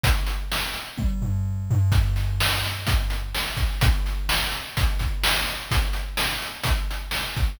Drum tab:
HH |xx-x----|xx-xxx-x|xx-xxx-x|xx-xxx-x|
SD |--o-----|--o---o-|--o---o-|--o---o-|
T1 |----o---|--------|--------|--------|
FT |-----o-o|--------|--------|--------|
BD |o---o---|o---o--o|o---oo--|o---o--o|